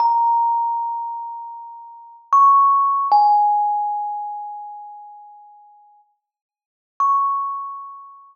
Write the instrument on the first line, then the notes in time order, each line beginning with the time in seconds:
kalimba
0.00 A#5
2.33 C#6
3.12 G#5
7.00 C#6